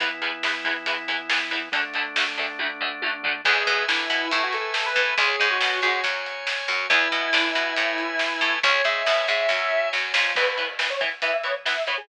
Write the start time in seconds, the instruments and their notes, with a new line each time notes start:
0.00 acoustic guitar (steel) E2 E3 B3, drawbar organ E3 B3 E4, kick, closed hi-hat
0.22 acoustic guitar (steel) E2 E3 B3, closed hi-hat
0.43 acoustic guitar (steel) E2 E3 B3, snare
0.64 acoustic guitar (steel) E2 E3 B3, kick, closed hi-hat
0.86 acoustic guitar (steel) E2 E3 B3, kick, closed hi-hat
1.08 acoustic guitar (steel) E2 E3 B3, closed hi-hat
1.29 acoustic guitar (steel) E2 E3 B3, snare
1.51 acoustic guitar (steel) E2 E3 B3, closed hi-hat
1.72 acoustic guitar (steel) D2 D3 A3, drawbar organ D3 A3 D4, kick, closed hi-hat
1.94 acoustic guitar (steel) D2 D3 A3, closed hi-hat
2.16 acoustic guitar (steel) D2 D3 A3, snare
2.37 acoustic guitar (steel) D2 D3 A3, closed hi-hat
2.59 acoustic guitar (steel) D2 D3 A3, kick, high tom
2.81 acoustic guitar (steel) D2 D3 A3, floor tom
3.02 acoustic guitar (steel) D2 D3 A3, high tom
3.23 acoustic guitar (steel) D2 D3 A3, floor tom
3.45 electric bass (finger) E2, acoustic guitar (steel) E3 G#3 B3, distortion guitar G#4, drawbar organ B4 E5 G#5, kick, crash
3.66 electric bass (finger) B2, acoustic guitar (steel) B3, kick, closed hi-hat
3.88 electric bass (finger) D3, acoustic guitar (steel) D4, distortion guitar E4, snare
4.10 electric bass (finger) B2, acoustic guitar (steel) B3, closed hi-hat
4.31 electric bass (finger) A2, acoustic guitar (steel) A3, distortion guitar E4, kick, closed hi-hat
4.43 distortion guitar F#4
4.53 distortion guitar A4, closed hi-hat
4.74 distortion guitar A4, snare
4.85 distortion guitar B4
4.96 electric bass (finger) A2, acoustic guitar (steel) A3, kick, closed hi-hat
5.18 electric bass (finger) C#2, acoustic guitar (steel) G#3 C#4, distortion guitar G#4, drawbar organ C#5 G#5, kick, closed hi-hat
5.40 electric bass (finger) G#2, acoustic guitar (steel) G#3, kick, closed hi-hat
5.50 distortion guitar F#4
5.61 electric bass (finger) B2, acoustic guitar (steel) B3, snare
5.82 electric bass (finger) G#2, acoustic guitar (steel) G#3, distortion guitar F#4, closed hi-hat
6.04 electric bass (finger) F#2, acoustic guitar (steel) F#3, kick, closed hi-hat
6.26 closed hi-hat
6.47 snare
6.68 electric bass (finger) F#2, acoustic guitar (steel) F#3, closed hi-hat
6.90 electric bass (finger) E2, acoustic guitar (steel) G#3 B3 E4, distortion guitar E4, drawbar organ B4 E5 G#5, kick, closed hi-hat
7.12 electric bass (finger) B2, acoustic guitar (steel) B3, kick, closed hi-hat
7.33 electric bass (finger) D3, acoustic guitar (steel) D4, snare
7.55 electric bass (finger) B2, acoustic guitar (steel) B3, closed hi-hat
7.76 electric bass (finger) A2, acoustic guitar (steel) A3, kick, closed hi-hat
7.98 closed hi-hat
8.19 snare
8.41 electric bass (finger) A2, acoustic guitar (steel) A3, kick, closed hi-hat
8.63 electric bass (finger) C#2, acoustic guitar (steel) G#3 C#4, distortion guitar C#5, drawbar organ C#5 G#5, kick, closed hi-hat
8.84 electric bass (finger) G#2, acoustic guitar (steel) G#3, distortion guitar E5, kick, closed hi-hat
9.06 electric bass (finger) B2, acoustic guitar (steel) B3, snare
9.28 electric bass (finger) G#2, acoustic guitar (steel) G#3, distortion guitar E5, closed hi-hat
9.49 electric bass (finger) F#2, acoustic guitar (steel) F#3, kick, snare
9.93 electric bass (finger) F#2, acoustic guitar (steel) F#3, snare
10.14 electric bass (finger) F2, acoustic guitar (steel) F3, snare
10.36 electric bass (finger) E2, acoustic guitar (steel) E3 B3, lead 1 (square) B4, kick, crash
10.58 acoustic guitar (steel) E3 B3, closed hi-hat
10.79 acoustic guitar (steel) E3 B3, snare
10.90 lead 1 (square) C#5
11.01 acoustic guitar (steel) E3 B3, kick, closed hi-hat
11.22 acoustic guitar (steel) E3 B3, electric bass (finger) E3, lead 1 (square) E5, kick, closed hi-hat
11.33 lead 1 (square) E5
11.44 acoustic guitar (steel) E3 B3, lead 1 (square) C#5, closed hi-hat
11.65 acoustic guitar (steel) E3 B3, lead 1 (square) E5, snare
11.87 acoustic guitar (steel) E3 B3, electric bass (finger) E3, lead 1 (square) C#5, closed hi-hat
11.97 lead 1 (square) G#4